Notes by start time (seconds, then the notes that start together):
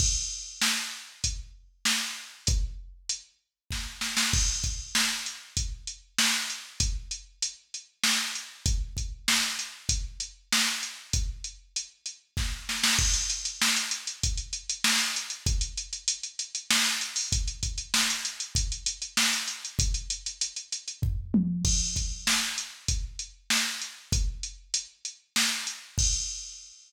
0.00 kick, crash
0.61 snare
1.24 kick, closed hi-hat
1.85 snare
2.47 kick, closed hi-hat
3.09 closed hi-hat
3.70 kick, snare
4.01 snare
4.17 snare
4.33 kick, crash
4.64 kick, closed hi-hat
4.95 snare
5.26 closed hi-hat
5.57 kick, closed hi-hat
5.87 closed hi-hat
6.18 snare
6.50 closed hi-hat
6.80 kick, closed hi-hat
7.11 closed hi-hat
7.42 closed hi-hat
7.74 closed hi-hat
8.03 snare
8.35 closed hi-hat
8.66 kick, closed hi-hat
8.97 kick, closed hi-hat
9.28 snare
9.59 closed hi-hat
9.89 kick, closed hi-hat
10.20 closed hi-hat
10.52 snare
10.83 closed hi-hat
11.13 kick, closed hi-hat
11.44 closed hi-hat
11.76 closed hi-hat
12.06 closed hi-hat
12.37 kick, snare
12.69 snare
12.84 snare
12.99 kick, crash
13.14 closed hi-hat
13.30 closed hi-hat
13.45 closed hi-hat
13.61 snare
13.76 closed hi-hat
13.91 closed hi-hat
14.07 closed hi-hat
14.23 kick, closed hi-hat
14.38 closed hi-hat
14.53 closed hi-hat
14.69 closed hi-hat
14.84 snare
14.99 closed hi-hat
15.16 closed hi-hat
15.30 closed hi-hat
15.46 kick, closed hi-hat
15.61 closed hi-hat
15.77 closed hi-hat
15.93 closed hi-hat
16.08 closed hi-hat
16.23 closed hi-hat
16.39 closed hi-hat
16.55 closed hi-hat
16.70 snare
16.86 closed hi-hat
17.01 closed hi-hat
17.16 open hi-hat
17.32 kick, closed hi-hat
17.48 closed hi-hat
17.63 kick, closed hi-hat
17.78 closed hi-hat
17.94 snare
18.10 closed hi-hat
18.25 closed hi-hat
18.40 closed hi-hat
18.55 kick, closed hi-hat
18.72 closed hi-hat
18.86 closed hi-hat
19.02 closed hi-hat
19.17 snare
19.33 closed hi-hat
19.48 closed hi-hat
19.65 closed hi-hat
19.79 kick, closed hi-hat
19.94 closed hi-hat
20.10 closed hi-hat
20.26 closed hi-hat
20.41 closed hi-hat
20.56 closed hi-hat
20.72 closed hi-hat
20.88 closed hi-hat
21.02 kick, floor tom
21.34 high tom
21.65 kick, crash
21.96 kick, closed hi-hat
22.27 snare
22.58 closed hi-hat
22.88 kick, closed hi-hat
23.19 closed hi-hat
23.50 snare
23.82 closed hi-hat
24.12 kick, closed hi-hat
24.43 closed hi-hat
24.74 closed hi-hat
25.05 closed hi-hat
25.36 snare
25.67 closed hi-hat
25.98 kick, crash